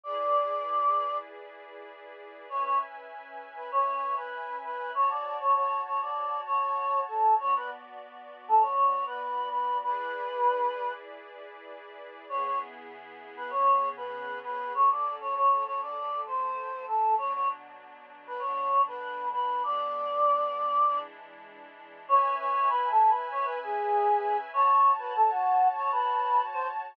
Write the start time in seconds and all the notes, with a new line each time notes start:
0.04 E4 G#4 B4 D5
2.49 C#4 B4 C#5 E5 G#5
2.63 C#5
3.56 B4
3.72 C#5
4.16 B4
4.64 B4
4.94 F#4 C#5 A5
5.11 D5
5.40 C#5
5.56 C#5
5.86 C#5
6.02 D5
6.46 C#5
7.08 A4
7.39 B3 F#4 C#5 D5
7.56 B4
8.48 A4
8.61 C#5
9.06 B4
9.52 B4
9.83 E4 G#4 B4 D5
12.29 C#3 B3 E4 G#4 C#5
12.44 C#5
13.37 B4
13.50 C#3 B3 C#4 G#4 C#5
13.97 B4
14.44 B4
14.74 F#3 C#4 A4 C#5
14.90 D5
15.21 C#5
15.35 C#5
15.66 C#5
15.82 D5
15.96 F#3 A3 A4
16.27 C5
16.88 A4
17.18 B2 F#3 D4 C#5
17.34 C#5
18.27 B4
18.39 B2 D3 D4 C#5
18.88 B4
19.33 B4
19.63 E3 G#3 B3 D4 D5
20.86 E3 G#3 D4 E4
22.08 C#4 B4 C#5 E5 G#5
22.39 C#5
22.69 B4
22.91 A4
23.09 B4
23.31 C#5
23.45 B4
23.63 G#4
24.53 F#4 C#5 A5
24.98 B4
25.16 A4
25.30 F#4
25.76 C#5
25.92 B4
26.53 C5